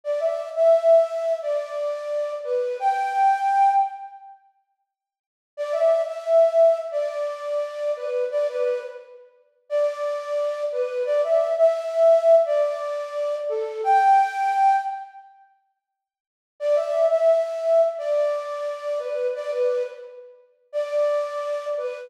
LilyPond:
\new Staff { \time 4/4 \key g \major \tempo 4 = 87 d''16 e''8 e''4~ e''16 d''4. b'8 | g''4. r2 r8 | d''16 e''8 e''4~ e''16 d''4. b'8 | d''16 b'8 r4 r16 d''4. b'8 |
d''16 e''8 e''4~ e''16 d''4. a'8 | g''4. r2 r8 | d''16 e''8 e''4~ e''16 d''4. b'8 | d''16 b'8 r4 r16 d''4. b'8 | }